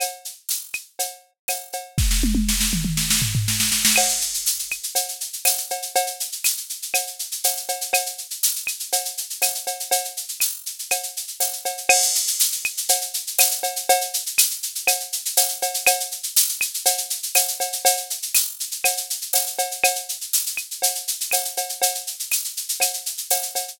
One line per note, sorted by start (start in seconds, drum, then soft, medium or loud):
0.00 cowbell medium
0.00 claves loud
0.00 shaker loud
0.25 shaker medium
0.49 tambourine medium
0.49 shaker loud
0.73 claves medium
0.73 shaker medium
0.99 cowbell medium
0.99 shaker medium
1.48 tambourine medium
1.48 cowbell medium
1.48 claves medium
1.48 shaker medium
1.73 cowbell medium
1.73 shaker medium
1.98 kick medium
1.98 snare medium
2.11 snare medium
2.23 high tom medium
2.35 high tom medium
2.49 snare medium
2.61 snare medium
2.73 mid tom medium
2.85 mid tom medium
2.97 snare medium
3.10 snare medium
3.22 floor tom medium
3.35 floor tom medium
3.48 snare medium
3.60 snare medium
3.72 snare medium
3.85 snare loud
3.96 crash loud
3.96 cowbell loud
3.96 claves loud
4.08 shaker medium
4.21 shaker medium
4.34 shaker medium
4.46 tambourine medium
4.46 shaker loud
4.59 shaker medium
4.71 claves medium
4.71 shaker medium
4.83 shaker medium
4.95 cowbell medium
4.95 shaker loud
5.08 shaker medium
5.21 shaker medium
5.33 shaker medium
5.45 tambourine loud
5.45 cowbell medium
5.45 claves medium
5.45 shaker loud
5.58 shaker medium
5.70 cowbell medium
5.70 shaker medium
5.82 shaker medium
5.95 cowbell loud
5.95 shaker loud
6.07 shaker medium
6.20 shaker medium
6.32 shaker medium
6.44 tambourine medium
6.44 claves medium
6.44 shaker loud
6.57 shaker medium
6.70 shaker medium
6.82 shaker medium
6.94 cowbell medium
6.94 claves loud
6.94 shaker loud
7.07 shaker medium
7.19 shaker medium
7.32 shaker medium
7.44 tambourine medium
7.44 cowbell medium
7.44 shaker loud
7.57 shaker medium
7.68 cowbell medium
7.68 shaker medium
7.81 shaker medium
7.93 cowbell loud
7.93 claves loud
7.93 shaker loud
8.06 shaker medium
8.18 shaker medium
8.31 shaker medium
8.43 tambourine medium
8.43 shaker loud
8.56 shaker medium
8.67 claves medium
8.67 shaker medium
8.80 shaker medium
8.92 cowbell medium
8.92 shaker loud
9.05 shaker medium
9.17 shaker medium
9.30 shaker medium
9.42 tambourine medium
9.42 cowbell medium
9.42 claves medium
9.42 shaker loud
9.55 shaker medium
9.67 cowbell medium
9.67 shaker medium
9.80 shaker medium
9.91 cowbell loud
9.91 shaker loud
10.05 shaker medium
10.17 shaker medium
10.29 shaker medium
10.40 tambourine medium
10.40 claves medium
10.40 shaker loud
10.66 shaker medium
10.79 shaker medium
10.91 cowbell medium
10.91 claves medium
10.91 shaker loud
11.03 shaker medium
11.17 shaker medium
11.28 shaker medium
11.40 tambourine medium
11.40 cowbell medium
11.40 shaker loud
11.53 shaker medium
11.65 cowbell medium
11.65 shaker medium
11.77 shaker medium
11.89 crash loud
11.89 cowbell loud
11.89 claves loud
12.02 shaker medium
12.15 shaker loud
12.27 shaker loud
12.40 tambourine medium
12.40 shaker loud
12.52 shaker medium
12.65 claves loud
12.65 shaker medium
12.77 shaker medium
12.89 cowbell medium
12.89 shaker loud
13.01 shaker medium
13.14 shaker medium
13.27 shaker medium
13.39 tambourine loud
13.39 cowbell medium
13.39 claves loud
13.39 shaker loud
13.51 shaker medium
13.63 cowbell medium
13.63 shaker medium
13.76 shaker medium
13.89 cowbell loud
13.89 shaker loud
14.01 shaker medium
14.14 shaker loud
14.26 shaker medium
14.38 tambourine medium
14.38 claves loud
14.38 shaker loud
14.51 shaker medium
14.63 shaker medium
14.75 shaker medium
14.87 cowbell medium
14.87 claves loud
14.87 shaker loud
15.00 shaker medium
15.13 shaker medium
15.25 shaker medium
15.37 tambourine medium
15.37 cowbell medium
15.37 shaker loud
15.49 shaker medium
15.62 cowbell medium
15.62 shaker medium
15.74 shaker medium
15.86 cowbell loud
15.86 claves loud
15.86 shaker loud
16.00 shaker medium
16.11 shaker medium
16.23 shaker medium
16.36 tambourine loud
16.36 shaker loud
16.49 shaker medium
16.61 claves loud
16.61 shaker loud
16.74 shaker medium
16.86 cowbell loud
16.86 shaker loud
16.98 shaker medium
17.10 shaker medium
17.23 shaker medium
17.35 tambourine medium
17.35 cowbell medium
17.35 claves loud
17.35 shaker loud
17.48 shaker medium
17.60 cowbell medium
17.60 shaker medium
17.73 shaker medium
17.85 cowbell loud
17.85 shaker loud
17.97 shaker medium
18.10 shaker medium
18.22 shaker medium
18.35 tambourine loud
18.35 claves medium
18.35 shaker loud
18.60 shaker medium
18.71 shaker medium
18.84 cowbell medium
18.84 claves loud
18.84 shaker loud
18.97 shaker medium
19.10 shaker medium
19.21 shaker medium
19.33 tambourine loud
19.33 cowbell medium
19.33 shaker loud
19.47 shaker medium
19.59 cowbell loud
19.59 shaker medium
19.71 shaker medium
19.84 cowbell loud
19.84 claves loud
19.84 shaker loud
19.95 shaker medium
20.09 shaker medium
20.21 shaker medium
20.33 tambourine medium
20.33 shaker loud
20.46 shaker medium
20.57 claves medium
20.57 shaker medium
20.71 shaker medium
20.82 cowbell medium
20.82 shaker loud
20.95 shaker medium
21.08 shaker loud
21.21 shaker medium
21.31 tambourine medium
21.31 cowbell medium
21.31 claves medium
21.31 shaker loud
21.45 shaker medium
21.57 cowbell medium
21.57 shaker medium
21.69 shaker medium
21.82 cowbell loud
21.82 shaker loud
21.95 shaker medium
22.07 shaker medium
22.20 shaker medium
22.31 tambourine medium
22.31 claves medium
22.31 shaker loud
22.44 shaker medium
22.57 shaker medium
22.69 shaker medium
22.80 cowbell medium
22.80 claves medium
22.80 shaker loud
22.93 shaker medium
23.06 shaker medium
23.17 shaker medium
23.30 tambourine medium
23.30 cowbell medium
23.30 shaker loud
23.42 shaker medium
23.55 cowbell medium
23.55 shaker medium
23.68 shaker medium